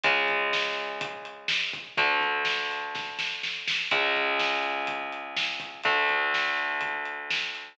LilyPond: <<
  \new Staff \with { instrumentName = "Overdriven Guitar" } { \time 4/4 \key cis \phrygian \tempo 4 = 124 <cis gis>1 | <d a>1 | <cis, cis gis>1 | <d, d a>1 | }
  \new Staff \with { instrumentName = "Electric Bass (finger)" } { \clef bass \time 4/4 \key cis \phrygian cis,1 | d,1 | r1 | r1 | }
  \new DrumStaff \with { instrumentName = "Drums" } \drummode { \time 4/4 <hh bd>8 <hh bd>8 sn8 hh8 <hh bd>8 hh8 sn8 <hh bd>8 | <hh bd>8 <hh bd>8 sn8 hh8 <bd sn>8 sn8 sn8 sn8 | <hh bd>8 <hh bd>8 sn8 hh8 <hh bd>8 hh8 sn8 <hh bd>8 | <hh bd>8 <hh bd>8 sn8 hh8 <hh bd>8 hh8 sn8 hh8 | }
>>